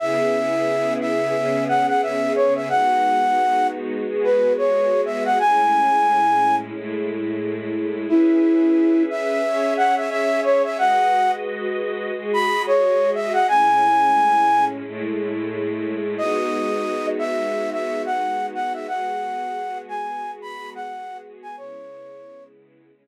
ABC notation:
X:1
M:4/4
L:1/16
Q:"Swing 16ths" 1/4=89
K:C#m
V:1 name="Flute"
e6 e4 f f e2 c e | f6 z3 B2 c3 e f | g8 z8 | E6 e4 f e e2 c e |
f3 z6 b2 c3 e f | g8 z8 | d6 e3 e2 f3 f e | f6 g3 b2 f3 z g |
c6 z10 |]
V:2 name="String Ensemble 1"
[C,B,EG]8 [C,B,CG]8 | [G,B,DF]8 [G,B,FG]8 | [A,,G,CE]8 [A,,G,A,E]8 | [CGBe]8 [CGce]8 |
[G,FBd]8 [G,FGd]8 | [A,,G,CE]8 [A,,G,A,E]8 | [G,B,DF]16 | [G,B,FG]16 |
[C,G,B,E]8 [C,G,CE]8 |]